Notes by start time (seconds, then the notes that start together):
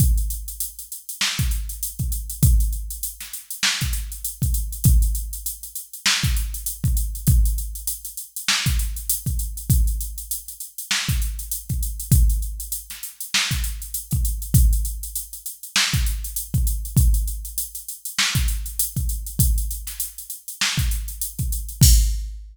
0.00 kick, closed hi-hat
0.18 closed hi-hat
0.30 closed hi-hat
0.48 closed hi-hat
0.60 closed hi-hat
0.79 closed hi-hat
0.92 closed hi-hat
1.09 closed hi-hat
1.21 snare
1.39 kick, closed hi-hat
1.51 closed hi-hat
1.69 closed hi-hat
1.83 closed hi-hat
1.99 kick, closed hi-hat
2.12 closed hi-hat
2.30 closed hi-hat
2.43 kick, closed hi-hat
2.60 closed hi-hat
2.72 closed hi-hat
2.90 closed hi-hat
3.03 closed hi-hat
3.20 snare, closed hi-hat
3.33 closed hi-hat
3.51 closed hi-hat
3.63 snare
3.81 kick, snare, closed hi-hat
3.93 closed hi-hat
4.12 closed hi-hat
4.24 closed hi-hat
4.42 kick, closed hi-hat
4.54 closed hi-hat
4.72 closed hi-hat
4.84 kick, closed hi-hat
5.02 closed hi-hat
5.15 closed hi-hat
5.33 closed hi-hat
5.46 closed hi-hat
5.63 closed hi-hat
5.76 closed hi-hat
5.93 closed hi-hat
6.06 snare
6.23 kick, snare, closed hi-hat
6.37 closed hi-hat
6.54 closed hi-hat
6.66 closed hi-hat
6.84 kick, closed hi-hat
6.97 closed hi-hat
7.15 closed hi-hat
7.27 kick, closed hi-hat
7.45 closed hi-hat
7.58 closed hi-hat
7.75 closed hi-hat
7.87 closed hi-hat
8.05 closed hi-hat
8.17 closed hi-hat
8.36 closed hi-hat
8.48 snare
8.66 kick, closed hi-hat
8.79 closed hi-hat
8.96 closed hi-hat
9.09 closed hi-hat
9.26 kick, closed hi-hat
9.39 closed hi-hat
9.57 closed hi-hat
9.70 kick, closed hi-hat
9.87 closed hi-hat
10.01 closed hi-hat
10.18 closed hi-hat
10.31 closed hi-hat
10.48 closed hi-hat
10.60 closed hi-hat
10.78 closed hi-hat
10.91 snare
11.09 kick, closed hi-hat
11.22 closed hi-hat
11.39 closed hi-hat
11.51 closed hi-hat
11.69 kick, closed hi-hat
11.83 closed hi-hat
12.00 closed hi-hat
12.12 kick, closed hi-hat
12.30 closed hi-hat
12.42 closed hi-hat
12.60 closed hi-hat
12.72 closed hi-hat
12.90 snare, closed hi-hat
13.03 closed hi-hat
13.20 closed hi-hat
13.34 snare
13.51 kick, snare, closed hi-hat
13.64 closed hi-hat
13.82 closed hi-hat
13.94 closed hi-hat
14.11 kick, closed hi-hat
14.25 closed hi-hat
14.42 closed hi-hat
14.54 kick, closed hi-hat
14.73 closed hi-hat
14.85 closed hi-hat
15.03 closed hi-hat
15.16 closed hi-hat
15.33 closed hi-hat
15.46 closed hi-hat
15.63 closed hi-hat
15.76 snare
15.93 kick, snare, closed hi-hat
16.06 closed hi-hat
16.24 closed hi-hat
16.36 closed hi-hat
16.54 kick, closed hi-hat
16.67 closed hi-hat
16.85 closed hi-hat
16.97 kick, closed hi-hat
17.14 closed hi-hat
17.28 closed hi-hat
17.45 closed hi-hat
17.58 closed hi-hat
17.75 closed hi-hat
17.89 closed hi-hat
18.05 closed hi-hat
18.19 snare
18.35 kick, closed hi-hat
18.48 closed hi-hat
18.66 closed hi-hat
18.79 closed hi-hat
18.96 kick, closed hi-hat
19.09 closed hi-hat
19.27 closed hi-hat
19.39 kick, closed hi-hat
19.58 closed hi-hat
19.71 closed hi-hat
19.87 snare, closed hi-hat
20.00 closed hi-hat
20.18 closed hi-hat
20.30 closed hi-hat
20.48 closed hi-hat
20.61 snare
20.78 kick, closed hi-hat
20.91 closed hi-hat
21.08 closed hi-hat
21.21 closed hi-hat
21.39 kick, closed hi-hat
21.52 closed hi-hat
21.69 closed hi-hat
21.81 kick, crash